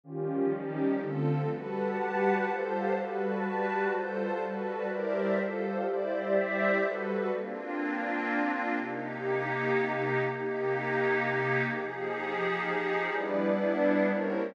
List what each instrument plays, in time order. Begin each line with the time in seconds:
0.04 pad 5 (bowed) D#3 F3 G3 C#4, pad 2 (warm) D#3 C#4 F4 G4
0.52 pad 2 (warm) D#3 C#4 D#4 G4
1.00 pad 5 (bowed) D3 F3 A3 C4, pad 2 (warm) D3 C4 F4 A4
1.49 pad 2 (warm) G3 F#4 A4 B4, pad 5 (bowed) G4 B4 F#5 A5
1.97 pad 2 (warm) G3 F#4 G4 B4
2.46 pad 2 (warm) G3 F4 A4 C5, pad 5 (bowed) G4 C5 F5 A5
2.93 pad 5 (bowed) G3 F#4 B4 A5, pad 2 (warm) G3 F#4 A4 B4
3.43 pad 2 (warm) G3 F#4 G4 B4
3.91 pad 2 (warm) G3 F4 A4 C5, pad 5 (bowed) G3 F4 C5 A5
4.39 pad 5 (bowed) G3 F#4 B4 A5, pad 2 (warm) G3 F#4 A4 B4
4.87 pad 2 (warm) G3 E4 A#4 C5 D5, pad 5 (bowed) G4 A#4 C5 D5 E5
5.36 pad 2 (warm) G3 F4 A4 C5, pad 5 (bowed) G4 A4 C5 F5
5.84 pad 2 (warm) G3 E4 C5 D5, pad 5 (bowed) G4 C5 D5 E5
6.33 pad 2 (warm) G3 E4 D5 E5
6.81 pad 5 (bowed) G3 F#4 A4 B4, pad 2 (warm) G3 F#4 A4 B4
7.30 pad 5 (bowed) A#3 C4 D4 F4
8.74 pad 5 (bowed) C3 A#3 D#4 G4
10.20 pad 5 (bowed) C3 A#3 D#4 G4
11.66 pad 5 (bowed) F3 D#4 G4 G#4
13.10 pad 5 (bowed) G3 B3 D4 E4, pad 2 (warm) G3 E4 B4 D5
14.07 pad 2 (warm) G3 E4 A#4 C5 C#5, pad 5 (bowed) G3 A#3 C4 C#4 E4